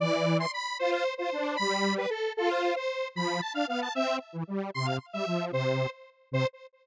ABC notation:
X:1
M:6/8
L:1/8
Q:3/8=152
K:C
V:1 name="Lead 1 (square)"
d3 c' b2 | c c2 c3 | b3 B A2 | A c2 c3 |
b2 a f f a | e2 z4 | c' f z e3 | c3 z3 |
c3 z3 |]
V:2 name="Lead 1 (square)"
E,4 z2 | F2 z F D2 | G,4 z2 | F3 z3 |
F,2 z D B,2 | C2 z E, G,2 | C,2 z G, F,2 | C,3 z3 |
C,3 z3 |]